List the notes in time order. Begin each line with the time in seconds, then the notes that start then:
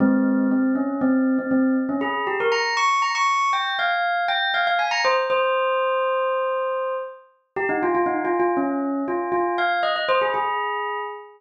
0.00 G#3 C4
0.51 C4
0.75 C#4
1.01 C4
1.38 C4
1.51 C4
1.89 C#4
2.01 G#4
2.27 G4
2.40 A#4
2.52 A#5
2.77 C#6
3.02 A#5
3.15 C#6
3.53 G5
3.79 F5
4.28 G5
4.54 F5
4.67 F5
4.79 G#5
4.91 A#5
5.05 C5
5.30 C5
7.56 G4
7.69 D#4
7.83 F4
7.95 F4
8.06 D#4
8.25 F4
8.40 F4
8.57 C#4
9.08 F4
9.32 F4
9.58 F5
9.83 D#5
9.96 D#5
10.09 C5
10.21 G#4
10.34 G#4